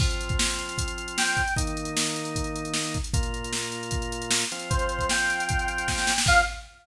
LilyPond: <<
  \new Staff \with { instrumentName = "Lead 1 (square)" } { \time 4/4 \key f \mixolydian \tempo 4 = 153 r2. g''4 | r1 | r1 | c''4 g''2. |
f''4 r2. | }
  \new Staff \with { instrumentName = "Drawbar Organ" } { \time 4/4 \key f \mixolydian <f c' f'>1 | <ees bes ees'>1 | <bes, bes f'>2.~ <bes, bes f'>8 <f c' f'>8~ | <f c' f'>1 |
<f c' f'>4 r2. | }
  \new DrumStaff \with { instrumentName = "Drums" } \drummode { \time 4/4 <cymc bd>16 hh16 hh16 <hh bd>16 sn16 hh16 hh16 hh16 <hh bd>16 hh16 hh16 hh16 sn16 hh16 <hh bd>16 hh16 | <hh bd>16 hh16 hh16 hh16 sn16 hh16 hh16 hh16 <hh bd>16 hh16 hh16 hh16 sn16 hh16 <hh bd>16 hh16 | <hh bd>16 hh16 hh16 hh16 sn16 hh16 hh16 hh16 <hh bd>16 hh16 hh16 hh16 sn16 hh16 hh16 hh16 | <hh bd>16 hh16 hh16 <hh bd>16 sn16 hh16 hh16 hh16 <hh bd>16 hh16 hh16 hh16 <bd sn>16 sn16 sn16 sn16 |
<cymc bd>4 r4 r4 r4 | }
>>